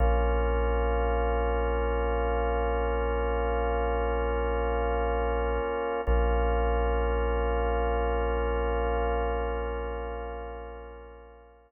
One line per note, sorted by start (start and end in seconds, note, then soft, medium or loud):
0.00 5.59 A#1 medium
0.00 6.01 A#3 medium
0.00 6.01 C#4 medium
0.00 6.01 F4 medium
6.07 11.66 A#1 medium
6.07 11.72 A#3 medium
6.07 11.72 C#4 medium
6.07 11.72 F4 medium